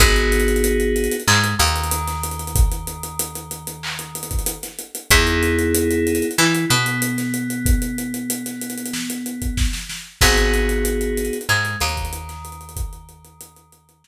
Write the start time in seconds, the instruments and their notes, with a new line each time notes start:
0.00 electric bass (finger) G#1, electric piano 2 B3 D#4 F#4 G#4, kick, closed hi-hat
0.16 closed hi-hat
0.32 closed hi-hat
0.40 closed hi-hat
0.48 closed hi-hat
0.56 closed hi-hat
0.64 closed hi-hat
0.80 closed hi-hat
0.96 closed hi-hat
1.04 closed hi-hat
1.11 closed hi-hat
1.20 closed hi-hat
1.28 electric bass (finger) G#2, electric piano 2 G#3, clap
1.44 closed hi-hat
1.59 electric bass (finger) D#2, electric piano 2 D#3, closed hi-hat
1.67 closed hi-hat
1.76 closed hi-hat
1.84 closed hi-hat
1.91 closed hi-hat
2.07 snare, closed hi-hat
2.23 closed hi-hat
2.31 closed hi-hat
2.39 closed hi-hat
2.47 closed hi-hat
2.55 kick, closed hi-hat
2.72 closed hi-hat
2.87 closed hi-hat
3.03 closed hi-hat
3.19 closed hi-hat
3.35 closed hi-hat
3.51 closed hi-hat
3.67 closed hi-hat
3.83 clap
3.99 closed hi-hat
4.15 closed hi-hat
4.23 closed hi-hat
4.31 kick, closed hi-hat
4.39 closed hi-hat
4.46 closed hi-hat
4.63 snare, closed hi-hat
4.79 closed hi-hat
4.95 closed hi-hat
5.11 electric bass (finger) E2, electric piano 2 B3 D#4 E4 G#4, kick, closed hi-hat
5.27 closed hi-hat
5.43 closed hi-hat
5.59 closed hi-hat
5.75 closed hi-hat
5.91 closed hi-hat
6.07 closed hi-hat
6.15 closed hi-hat
6.22 closed hi-hat
6.31 closed hi-hat
6.38 electric bass (finger) E3, electric piano 2 E4, clap
6.55 closed hi-hat
6.70 electric bass (finger) B2, electric piano 2 B3, closed hi-hat
6.86 closed hi-hat
7.02 closed hi-hat
7.18 snare, closed hi-hat
7.34 closed hi-hat
7.50 closed hi-hat
7.66 kick, closed hi-hat
7.82 closed hi-hat
7.98 closed hi-hat
8.14 closed hi-hat
8.30 closed hi-hat
8.46 snare, closed hi-hat
8.61 closed hi-hat
8.70 closed hi-hat
8.78 closed hi-hat
8.86 closed hi-hat
8.93 snare
9.10 closed hi-hat
9.26 closed hi-hat
9.42 kick, closed hi-hat
9.57 kick, snare
9.73 snare
9.89 snare
10.21 electric bass (finger) G#1, electric piano 2 B3 D#4 F#4 G#4, kick, crash
10.38 closed hi-hat
10.54 closed hi-hat
10.69 closed hi-hat
10.85 closed hi-hat
11.01 closed hi-hat
11.17 closed hi-hat
11.25 closed hi-hat
11.33 closed hi-hat
11.41 closed hi-hat
11.49 electric bass (finger) G#2, electric piano 2 G#3, clap
11.65 closed hi-hat
11.80 electric bass (finger) D#2, electric piano 2 D#3, closed hi-hat
11.89 closed hi-hat
11.97 kick, closed hi-hat
12.05 closed hi-hat
12.13 closed hi-hat
12.29 snare, closed hi-hat
12.45 closed hi-hat
12.52 closed hi-hat
12.61 closed hi-hat
12.69 closed hi-hat
12.76 kick, closed hi-hat
12.93 closed hi-hat
13.09 closed hi-hat
13.24 closed hi-hat
13.41 closed hi-hat
13.56 closed hi-hat
13.72 closed hi-hat
13.89 closed hi-hat
14.04 snare